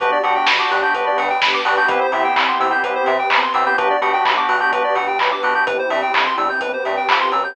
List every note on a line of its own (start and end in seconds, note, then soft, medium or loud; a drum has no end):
0.00 0.13 G1 medium
0.00 0.18 B3 loud
0.00 0.94 B3 medium
0.00 0.18 D4 medium
0.00 0.94 D4 medium
0.00 0.18 F#4 loud
0.00 0.94 F#4 medium
0.00 0.18 G4 medium
0.00 0.94 G4 medium
0.00 0.11 B4 medium
0.00 kick loud
0.00 closed hi-hat loud
0.12 0.23 D5 medium
0.23 0.37 G2 medium
0.23 0.51 B3 medium
0.23 0.51 D4 medium
0.23 0.51 F#4 medium
0.23 0.51 G4 medium
0.23 0.34 F#5 medium
0.23 open hi-hat medium
0.36 0.46 G5 medium
0.47 0.60 G1 medium
0.47 0.58 B5 medium
0.47 kick medium
0.47 snare loud
0.59 0.78 B3 medium
0.59 0.78 D4 medium
0.59 0.78 F#4 medium
0.59 0.78 G4 medium
0.59 0.70 D6 medium
0.71 0.84 G2 medium
0.71 0.81 F#6 medium
0.71 open hi-hat medium
0.82 1.20 B3 medium
0.82 1.20 D4 medium
0.82 1.20 F#4 medium
0.82 1.20 G4 medium
0.82 0.93 G6 medium
0.94 1.07 G1 medium
0.94 1.88 B3 medium
0.94 1.88 D4 medium
0.94 1.88 G4 medium
0.94 1.88 B4 medium
0.94 1.05 B4 medium
0.94 kick loud
0.94 closed hi-hat loud
1.06 1.17 D5 medium
1.18 1.31 G2 medium
1.18 1.29 F#5 medium
1.18 open hi-hat loud
1.30 1.41 G5 medium
1.42 1.55 G1 medium
1.42 1.53 B5 medium
1.42 kick loud
1.42 snare loud
1.54 1.64 D6 medium
1.65 1.79 G2 medium
1.65 1.74 B3 medium
1.65 1.74 D4 medium
1.65 1.74 F#4 medium
1.65 1.74 G4 medium
1.65 1.76 F#6 medium
1.65 open hi-hat loud
1.77 1.87 B3 medium
1.77 1.87 D4 medium
1.77 1.87 F#4 medium
1.77 1.87 G4 medium
1.77 1.88 G6 medium
1.88 2.02 C2 loud
1.88 2.07 B3 loud
1.88 2.82 B3 medium
1.88 2.07 C4 loud
1.88 2.82 C4 medium
1.88 2.07 E4 loud
1.88 2.82 E4 medium
1.88 2.07 G4 loud
1.88 2.82 G4 medium
1.88 2.00 B4 medium
1.88 kick loud
1.88 closed hi-hat loud
2.01 2.11 C5 medium
2.12 2.25 C3 medium
2.12 2.41 B3 medium
2.12 2.41 C4 medium
2.12 2.41 E4 medium
2.12 2.41 G4 medium
2.12 2.23 E5 medium
2.12 open hi-hat loud
2.24 2.35 G5 medium
2.36 2.49 C2 medium
2.36 2.47 B5 medium
2.36 kick loud
2.36 clap loud
2.48 2.67 B3 medium
2.48 2.67 C4 medium
2.48 2.67 E4 medium
2.48 2.67 G4 medium
2.48 2.59 C6 medium
2.60 2.73 C3 medium
2.60 2.71 E6 medium
2.60 open hi-hat loud
2.71 3.08 B3 medium
2.71 3.08 C4 medium
2.71 3.08 E4 medium
2.71 3.08 G4 medium
2.71 2.82 G6 medium
2.83 2.97 C2 medium
2.83 3.77 B3 medium
2.83 3.77 C4 medium
2.83 3.77 G4 medium
2.83 2.94 B4 medium
2.83 3.77 B4 medium
2.83 kick loud
2.83 closed hi-hat loud
2.95 3.06 C5 medium
3.06 3.20 C3 medium
3.06 3.18 E5 medium
3.06 open hi-hat loud
3.19 3.30 G5 medium
3.30 3.43 C2 medium
3.30 3.42 B5 medium
3.30 kick loud
3.30 clap loud
3.42 3.53 C6 medium
3.54 3.67 C3 medium
3.54 3.64 B3 medium
3.54 3.64 C4 medium
3.54 3.64 E4 medium
3.54 3.64 G4 medium
3.54 3.65 E6 medium
3.54 open hi-hat loud
3.66 3.76 B3 medium
3.66 3.76 C4 medium
3.66 3.76 E4 medium
3.66 3.76 G4 medium
3.66 3.77 G6 medium
3.78 3.92 B1 medium
3.78 3.97 B3 loud
3.78 4.72 B3 medium
3.78 3.97 D4 medium
3.78 4.72 D4 medium
3.78 3.97 F#4 medium
3.78 4.72 F#4 medium
3.78 3.97 G4 loud
3.78 4.72 G4 medium
3.78 3.88 B4 medium
3.78 kick loud
3.78 closed hi-hat loud
3.90 4.01 D5 medium
4.01 4.14 B2 medium
4.01 4.30 B3 medium
4.01 4.30 D4 medium
4.01 4.30 F#4 medium
4.01 4.30 G4 medium
4.01 4.12 F#5 medium
4.01 open hi-hat loud
4.13 4.24 G5 medium
4.25 4.39 B1 medium
4.25 4.36 B5 medium
4.25 kick loud
4.25 clap loud
4.37 4.56 B3 medium
4.37 4.56 D4 medium
4.37 4.56 F#4 medium
4.37 4.56 G4 medium
4.37 4.48 D6 medium
4.49 4.62 B2 medium
4.49 4.60 F#6 medium
4.49 open hi-hat loud
4.60 4.98 B3 medium
4.60 4.98 D4 medium
4.60 4.98 F#4 medium
4.60 4.98 G4 medium
4.60 4.71 G6 medium
4.72 4.85 B1 medium
4.72 5.66 B3 medium
4.72 5.66 D4 medium
4.72 5.66 G4 medium
4.72 4.83 B4 medium
4.72 5.66 B4 medium
4.72 kick loud
4.72 closed hi-hat loud
4.84 4.95 D5 medium
4.95 5.09 B2 medium
4.95 5.06 F#5 medium
4.95 open hi-hat loud
5.08 5.19 G5 medium
5.19 5.33 B1 medium
5.19 5.30 B5 medium
5.19 kick loud
5.19 clap loud
5.31 5.42 D6 medium
5.43 5.56 B2 medium
5.43 5.54 B3 medium
5.43 5.54 D4 medium
5.43 5.54 F#4 medium
5.43 5.54 G4 medium
5.43 5.54 F#6 medium
5.43 open hi-hat medium
5.55 5.64 B3 medium
5.55 5.64 D4 medium
5.55 5.64 F#4 medium
5.55 5.64 G4 medium
5.55 5.66 G6 medium
5.67 5.80 G1 medium
5.67 6.60 B3 medium
5.67 6.60 C4 medium
5.67 6.60 E4 medium
5.67 6.60 G4 medium
5.67 5.77 B4 medium
5.67 kick loud
5.67 closed hi-hat loud
5.79 5.90 C5 medium
5.90 6.03 G2 medium
5.90 6.01 E5 medium
5.90 open hi-hat loud
6.02 6.13 G5 medium
6.14 6.27 G1 medium
6.14 6.25 B5 medium
6.14 kick loud
6.14 clap loud
6.26 6.37 C6 medium
6.38 6.51 G2 medium
6.38 6.49 E6 medium
6.38 open hi-hat medium
6.50 6.60 G6 medium
6.61 6.75 G1 medium
6.61 7.55 B3 medium
6.61 7.55 C4 medium
6.61 7.55 G4 medium
6.61 7.55 B4 medium
6.61 6.72 B4 medium
6.61 kick loud
6.61 closed hi-hat loud
6.73 6.84 C5 medium
6.85 6.99 G2 medium
6.85 6.96 E5 medium
6.85 open hi-hat medium
6.97 7.08 G5 medium
7.09 7.30 F2 medium
7.09 7.19 B5 medium
7.09 kick loud
7.09 clap loud
7.21 7.31 C6 medium
7.32 7.53 F#2 medium
7.32 7.43 E6 medium
7.32 open hi-hat medium
7.44 7.55 G6 medium